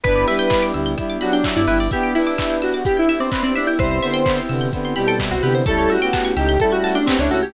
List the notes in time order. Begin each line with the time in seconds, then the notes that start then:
0.03 G1 B3 D4 E4 G4 B4, kick, closed hi-hat
0.15 D5
0.28 G3 E4 B4 E5, open hi-hat
0.39 G5
0.50 B3 D4 E4 G4 B5, kick, clap
0.62 D6
0.74 D2 G3 E4 E6, open hi-hat
0.86 G6
0.97 G3 B3 D4 E4 G4 E6, kick, closed hi-hat
1.10 D6
1.21 F#3 D4 F#4 B5, open hi-hat
1.33 D4 G5
1.44 B3 D4 E4 G4 E5, kick, clap
1.56 G2 E4 D5
1.67 G1 G3 E4 B4, open hi-hat
1.80 D5
1.91 B3 D4 E4 G4 E5, kick, closed hi-hat
2.03 G5
2.15 D4 E4 B4 B5, open hi-hat
2.27 D6
2.38 B3 D4 E4 G4 E6, kick, clap
2.50 G6
2.62 F#4 E6, open hi-hat
2.74 D6
2.85 B3 D4 E4 G4 B5, kick, closed hi-hat
2.97 E4 G5
3.08 E4 E5, open hi-hat
3.20 C4 D5
3.31 B3 C4 D4 E4 G4 B4, kick, clap
3.43 C4 D5
3.55 D4 E5, open hi-hat
3.67 E4 G5
3.79 C2 G3 B3 C4 E4 G4 B4 C5, kick, closed hi-hat
3.91 C5
4.02 D3 B3 C5 E5, open hi-hat
4.14 G5
4.26 B3 C4 E4 G4 B5, kick, clap
4.38 C6
4.49 C3 D3 B3 E6, open hi-hat
4.61 G6
4.73 D3 B3 C4 E4 G4 E6, kick, closed hi-hat
4.85 C6
4.96 B2 G3 G4 B5, open hi-hat
5.07 A4 G5
5.19 B3 C4 E4 G4 E5, kick, clap
5.31 C2 F#4 C5
5.43 C3 D3 B3 G4 B4, open hi-hat
5.55 C5
5.66 C#2 G3 A3 C#4 E4 G4 A4, kick, closed hi-hat
5.78 C#5
5.90 F#4 E5, open hi-hat
6.02 B3 G4 G5
6.13 A3 C#4 E4 G4 A5, kick, clap
6.25 C#6
6.36 C#2 D#4 G4 E6, open hi-hat
6.49 G6
6.59 G3 A3 C#4 E4 G4 A4 E6, kick, closed hi-hat
6.72 F#4 C#6
6.84 F#4 A5, open hi-hat
6.95 D4 G5
7.06 A3 B3 C4 C#4 E4 G4 E5, kick, clap
7.19 C#2 D4 E4 C#5
7.30 C#2 E4 F#4 A4 C#5, open hi-hat
7.43 G4 C#5